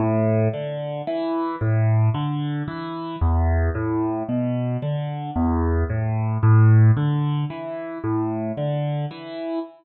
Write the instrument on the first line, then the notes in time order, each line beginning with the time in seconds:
acoustic grand piano
0.00 A2
0.54 D3
1.07 E3
1.61 A2
2.14 D3
2.68 E3
3.21 E2
3.75 A2
4.29 B2
4.82 D3
5.36 E2
5.90 A2
6.43 A2
6.97 D3
7.50 E3
8.04 A2
8.57 D3
9.11 E3